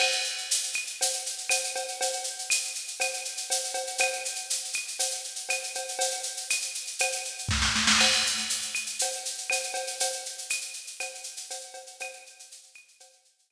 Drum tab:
CC |x---------------|----------------|----------------|----------------|
SH |-xxxxxxxxxxxxxxx|xxxxxxxxxxxxxxxx|xxxxxxxxxxxxxxxx|xxxxxxxxxxxx----|
CB |x-------x---x-x-|x-------x---x-x-|x-------x---x-x-|x-------x-------|
CL |x-----x-----x---|----x---x-------|x-----x-----x---|----x---x-------|
SD |----------------|----------------|----------------|------------oooo|
BD |----------------|----------------|----------------|------------o---|

CC |x---------------|----------------|----------------|
SH |-xxxxxxxxxxxxxxx|xxxxxxxxxxxxxxxx|xxxxxxxxxxxxx---|
CB |x-------x---x-x-|x-------x---x-x-|x-------x---x---|
CL |x-----x-----x---|----x---x-------|x-----x-----x---|
SD |----------------|----------------|----------------|
BD |----------------|----------------|----------------|